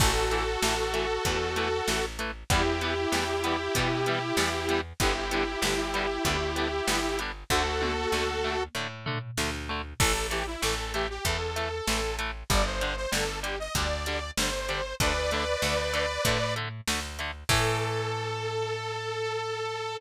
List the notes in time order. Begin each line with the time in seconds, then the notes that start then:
0.00 A1 E3 A3 F#4 A4, kick, crash
0.31 E3 A3, closed hi-hat
0.62 A1 E3 A3, snare
0.93 E3 A3, closed hi-hat
1.25 E2 E3 A3, kick, closed hi-hat
1.56 E3 A3, closed hi-hat
1.88 A1 E3 A3, snare
2.19 E3 A3, closed hi-hat
2.50 E2 E3 G3 B3 E4 G4, kick, closed hi-hat
2.81 E3 G3 B3, closed hi-hat
3.12 E2 E3 G3 B3, snare
3.44 E3 G3 B3, closed hi-hat
3.75 B2 E3 G3 B3, kick, closed hi-hat
4.06 E3 G3 B3, closed hi-hat
4.37 E2 E3 G3 B3, snare
4.68 E3 G3 B3, closed hi-hat
5.00 G1 D3 G3 B3 E4 G4, kick, closed hi-hat
5.31 D3 G3 B3, closed hi-hat
5.62 G1 D3 G3 B3, snare
5.94 D3 G3 B3, closed hi-hat
6.24 D2 D3 G3 B3, kick, closed hi-hat
6.56 D3 G3 B3, closed hi-hat
6.87 G1 D3 G3 B3, snare
7.19 D3 G3 B3, closed hi-hat
7.50 D2 D3 A3 F#4 A4, kick
7.81 D3 A3, high tom
8.12 D2 D3 A3, snare
8.44 D3 A3
8.75 A2 D3 A3
9.06 D3 A3, floor tom
9.38 D2 D3 A3, snare
9.69 D3 A3
10.00 A1 E3 A3 A4, kick, crash
10.31 E3 A3 G4, closed hi-hat
10.47 E4
10.62 A1 E3 A3 A4, snare
10.94 E3 A3 G4, closed hi-hat
11.10 G4
11.25 E2 E3 A3 A4, kick, closed hi-hat
11.56 E3 A3, closed hi-hat
11.87 A1 E3 A3, snare
12.19 E3 A3, closed hi-hat
12.50 G1 D3 G3 D5, kick, closed hi-hat
12.66 C5
12.81 D3 G3, closed hi-hat
12.97 C5
13.12 G1 D3 G3 A4, snare
13.43 D3 G3 G4, closed hi-hat
13.60 D#5
13.75 D2 D3 G3 D5, kick, closed hi-hat
14.06 D3 G3, closed hi-hat
14.37 G1 D3 G3 C5, snare
14.69 D3 G3, closed hi-hat
15.00 D2 D3 A3 B4 D5, kick, closed hi-hat
15.31 D3 A3, closed hi-hat
15.62 D2 D3 A3, snare
15.93 D3 A3, closed hi-hat
16.25 A2 D3 A3, kick, closed hi-hat
16.56 D3 A3, closed hi-hat
16.88 D2 D3 A3, snare
17.19 D3 A3, closed hi-hat
17.49 A2 E3 A3 A4, kick, crash